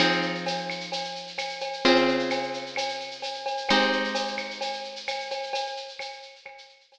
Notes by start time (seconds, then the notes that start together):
0.00 F3 C4 D#4 G#4, cowbell, claves, shaker
0.12 shaker
0.22 shaker
0.35 shaker
0.46 tambourine, cowbell, shaker
0.57 shaker
0.70 claves, shaker
0.80 shaker
0.92 cowbell, shaker
1.04 shaker
1.16 shaker
1.27 shaker
1.38 tambourine, cowbell, claves, shaker
1.49 shaker
1.60 cowbell, shaker
1.73 shaker
1.85 C#3 C4 F4 G#4, cowbell, shaker
1.96 shaker
2.08 shaker
2.19 shaker
2.30 tambourine, cowbell, claves, shaker
2.43 shaker
2.54 shaker
2.66 shaker
2.76 cowbell, claves, shaker
2.89 shaker
3.00 shaker
3.11 shaker
3.22 tambourine, cowbell, shaker
3.34 shaker
3.46 cowbell, shaker
3.57 shaker
3.69 G#3 C4 D#4 G4, cowbell, claves, shaker
3.81 shaker
3.92 shaker
4.04 shaker
4.15 tambourine, cowbell, shaker
4.27 shaker
4.37 claves, shaker
4.51 shaker
4.61 cowbell, shaker
4.73 shaker
4.84 shaker
4.96 shaker
5.08 tambourine, cowbell, claves, shaker
5.20 shaker
5.31 cowbell, shaker
5.43 shaker
5.53 cowbell, shaker
5.67 shaker
5.77 shaker
5.88 shaker
5.99 tambourine, cowbell, claves, shaker
6.13 shaker
6.22 shaker
6.36 shaker
6.46 cowbell, claves
6.58 shaker
6.69 shaker
6.80 shaker
6.92 tambourine, cowbell, shaker